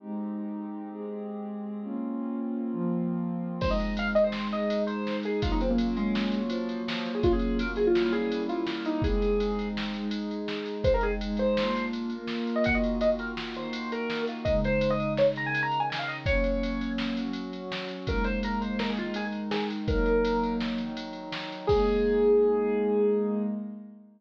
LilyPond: <<
  \new Staff \with { instrumentName = "Acoustic Grand Piano" } { \time 5/4 \key aes \mixolydian \tempo 4 = 166 r1 r4 | r1 r4 | c''16 ees''8. f''16 r16 ees''16 c''8. ees''4 c''4 aes'8 | f'16 ees'16 c'16 bes8. aes4. f4 f8. aes'16 |
f'16 aes'8. bes'16 r16 aes'16 f'8. aes'4 f'4 ees'8 | aes'2 r2. | c''16 bes'16 aes'16 r8. c''4. r4. r16 ees''16 | ges''16 ees''8. ees''16 r16 bes'16 r8. c''4 bes'4 f'8 |
ees''8 c''8. ees''8. des''16 r16 bes''16 aes''8 bes''8 aes''16 aes''16 f''16 ees''16 r16 | des''2 r2. | bes'8 c''8 bes'8 c''8 bes'16 aes'16 f'8 aes'16 aes'8 r16 aes'8 r8 | bes'2 r2. |
aes'1~ aes'4 | }
  \new Staff \with { instrumentName = "Pad 2 (warm)" } { \time 5/4 \key aes \mixolydian <aes c' ees' g'>2~ <aes c' ees' g'>8 <aes c' g' aes'>2~ <aes c' g' aes'>8 | <bes c' des' f'>2~ <bes c' des' f'>8 <f bes c' f'>2~ <f bes c' f'>8 | <aes c' ees'>2~ <aes c' ees'>8 <aes ees' aes'>2~ <aes ees' aes'>8 | <ges bes des' f'>2~ <ges bes des' f'>8 <ges bes f' ges'>2~ <ges bes f' ges'>8 |
<ges bes des' f'>4 <ges bes f' ges'>4 <g bes des' fes'>4. <g bes fes' g'>4. | <aes c' ees'>2~ <aes c' ees'>8 <aes ees' aes'>2~ <aes ees' aes'>8 | <aes c' ees'>4 <aes ees' aes'>4 <bes d' f'>4. <bes f' bes'>4. | <ees bes f' ges'>2~ <ees bes f' ges'>8 <ees bes ees' ges'>2~ <ees bes ees' ges'>8 |
<des aes ees'>2~ <des aes ees'>8 <des ees ees'>2~ <des ees ees'>8 | <ges bes des'>2~ <ges bes des'>8 <ges des' ges'>2~ <ges des' ges'>8 | <aes bes ees'>2~ <aes bes ees'>8 <ees aes ees'>2~ <ees aes ees'>8 | <ges bes ees'>2~ <ges bes ees'>8 <ees ges ees'>2~ <ees ges ees'>8 |
<aes bes ees'>1~ <aes bes ees'>4 | }
  \new DrumStaff \with { instrumentName = "Drums" } \drummode { \time 5/4 r4 r4 r4 r4 r4 | r4 r4 r4 r4 r4 | <cymc bd>8 cymr8 cymr8 cymr8 sn8 cymr8 cymr8 cymr8 sn8 cymr8 | <bd cymr>8 cymr8 cymr8 cymr8 sn8 cymr8 cymr8 cymr8 sn8 cymr8 |
<bd cymr>8 cymr8 cymr8 cymr8 sn8 cymr8 cymr8 cymr8 sn8 cymr8 | <bd cymr>8 cymr8 cymr8 cymr8 sn8 cymr8 cymr8 cymr8 sn8 cymr8 | <bd cymr>8 cymr8 cymr8 cymr8 sn8 cymr8 cymr8 cymr8 sn8 cymr8 | <bd cymr>8 cymr8 cymr8 cymr8 sn8 cymr8 cymr8 cymr8 sn8 cymr8 |
<bd cymr>8 cymr8 cymr8 cymr8 sn8 cymr8 cymr8 cymr8 sn8 cymr8 | <bd cymr>8 cymr8 cymr8 cymr8 sn8 cymr8 cymr8 cymr8 sn8 cymr8 | <bd cymr>8 cymr8 cymr8 cymr8 sn8 cymr8 cymr8 cymr8 sn8 cymr8 | <bd cymr>8 cymr8 cymr8 cymr8 sn8 cymr8 cymr8 cymr8 sn8 cymr8 |
<cymc bd>4 r4 r4 r4 r4 | }
>>